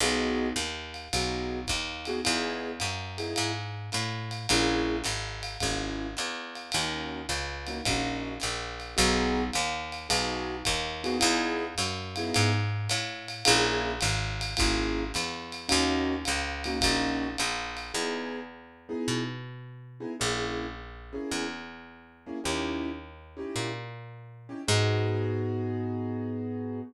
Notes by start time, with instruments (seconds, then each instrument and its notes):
0.00 electric bass (finger) B1, acoustic grand piano B3 D#4 F#4 G#4, ride
0.56 electric bass (finger) D#2, hi-hat pedal, ride
0.94 ride
1.13 electric bass (finger) B1, acoustic grand piano B3 D#4 F#4 G#4, ride
1.67 electric bass (finger) D#2, kick, hi-hat pedal, ride
2.05 acoustic grand piano B3 D#4 F#4 G#4, ride
2.25 electric bass (finger) E2, acoustic grand piano B3 D#4 E4 G#4, ride
2.80 electric bass (finger) F#2, hi-hat pedal, ride
3.18 acoustic grand piano B3 D#4 E4 G#4, ride
3.36 electric bass (finger) G#2, ride
3.92 electric bass (finger) A2, hi-hat pedal, ride
4.31 ride
4.49 electric bass (finger) A#1, acoustic grand piano A#3 C#4 E4 G#4, ride
5.04 electric bass (finger) G#1, hi-hat pedal, ride
5.43 ride
5.60 electric bass (finger) G#1, acoustic grand piano A#3 C#4 E4 G#4, kick, ride
6.17 electric bass (finger) E2, hi-hat pedal, ride
6.55 ride
6.72 electric bass (finger) D#2, acoustic grand piano A#3 C#4 D#4 F#4, ride
7.29 electric bass (finger) C#2, hi-hat pedal, ride
7.67 acoustic grand piano A#3 C#4 D#4 F#4, ride
7.85 electric bass (finger) A#1, acoustic grand piano A#3 C#4 D#4 F#4, kick, ride
8.40 electric bass (finger) A#1, hi-hat pedal, ride
8.80 ride
8.97 electric bass (finger) B1, acoustic grand piano B3 D#4 F#4 G#4, ride
9.53 electric bass (finger) D#2, hi-hat pedal, ride
9.92 ride
10.09 electric bass (finger) B1, acoustic grand piano B3 D#4 F#4 G#4, ride
10.65 electric bass (finger) D#2, kick, hi-hat pedal, ride
11.04 acoustic grand piano B3 D#4 F#4 G#4, ride
11.19 electric bass (finger) E2, acoustic grand piano B3 D#4 E4 G#4, ride
11.78 electric bass (finger) F#2, hi-hat pedal, ride
12.16 acoustic grand piano B3 D#4 E4 G#4, ride
12.34 electric bass (finger) G#2, ride
12.89 electric bass (finger) A2, hi-hat pedal, ride
13.28 ride
13.45 electric bass (finger) A#1, acoustic grand piano A#3 C#4 E4 G#4, ride
14.01 electric bass (finger) G#1, hi-hat pedal, ride
14.41 ride
14.57 electric bass (finger) G#1, acoustic grand piano A#3 C#4 E4 G#4, kick, ride
15.14 electric bass (finger) E2, hi-hat pedal, ride
15.52 ride
15.69 electric bass (finger) D#2, acoustic grand piano A#3 C#4 D#4 F#4, ride
16.25 electric bass (finger) C#2, hi-hat pedal, ride
16.64 acoustic grand piano A#3 C#4 D#4 F#4, ride
16.81 electric bass (finger) A#1, acoustic grand piano A#3 C#4 D#4 F#4, kick, ride
17.38 electric bass (finger) A#1, hi-hat pedal, ride
17.77 ride
17.94 electric bass (finger) E2, acoustic grand piano B3 D#4 E4 G#4
18.89 acoustic grand piano B3 D#4 E4 G#4
19.08 electric bass (finger) B2
20.00 acoustic grand piano B3 D#4 E4 G#4
20.20 electric bass (finger) A#1, acoustic grand piano A#3 C#4 E4 G#4
21.13 acoustic grand piano A#3 C#4 E4 G#4
21.31 electric bass (finger) E2
22.26 acoustic grand piano A#3 C#4 E4 G#4
22.44 electric bass (finger) D#2, acoustic grand piano C#4 D#4 E4 G4
23.37 acoustic grand piano C#4 D#4 E4 G4
23.56 electric bass (finger) A#2
24.49 acoustic grand piano C#4 D#4 E4 G4
24.68 electric bass (finger) G#2, acoustic grand piano B3 D#4 F#4 G#4